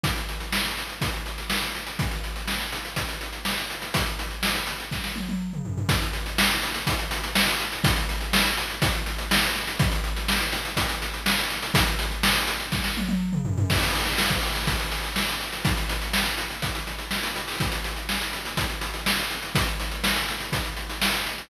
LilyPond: \new DrumStaff \drummode { \time 4/4 \tempo 4 = 123 <hh bd>16 hh16 hh16 hh16 sn16 hh16 hh16 hh16 <hh bd>16 hh16 hh16 hh16 sn16 hh16 hh16 hh16 | <hh bd>16 hh16 hh16 hh16 sn16 hh16 hh16 hh16 <hh bd>16 hh16 hh16 hh16 sn16 hh16 hh16 hh16 | <hh bd>16 hh16 hh16 hh16 sn16 hh16 hh16 hh16 <bd sn>16 sn16 tommh16 tommh16 r16 toml16 tomfh16 tomfh16 | <hh bd>16 hh16 hh16 hh16 sn16 hh16 hh16 hh16 <hh bd>16 hh16 hh16 hh16 sn16 hh16 hh16 hh16 |
<hh bd>16 hh16 hh16 hh16 sn16 hh16 hh16 hh16 <hh bd>16 hh16 hh16 hh16 sn16 hh16 hh16 hh16 | <hh bd>16 hh16 hh16 hh16 sn16 hh16 hh16 hh16 <hh bd>16 hh16 hh16 hh16 sn16 hh16 hh16 hh16 | <hh bd>16 hh16 hh16 hh16 sn16 hh16 hh16 hh16 <bd sn>16 sn16 tommh16 tommh16 r16 toml16 tomfh16 tomfh16 | <cymc bd>16 hh16 hh16 hh16 sn16 bd16 hh16 hh16 <hh bd>16 hh16 hh16 hh16 sn16 hh16 hh16 hh16 |
<hh bd>16 hh16 hh16 hh16 sn16 hh16 hh16 hh16 <hh bd>16 hh16 hh16 hh16 sn16 hh16 hh16 hho16 | <hh bd>16 hh16 hh16 hh16 sn16 hh16 hh16 hh16 <hh bd>16 hh16 hh16 hh16 sn16 hh16 hh16 hh16 | <hh bd>16 hh16 hh16 hh16 sn16 hh16 hh16 hh16 <hh bd>16 hh16 hh16 hh16 sn16 hh16 hh16 hh16 | }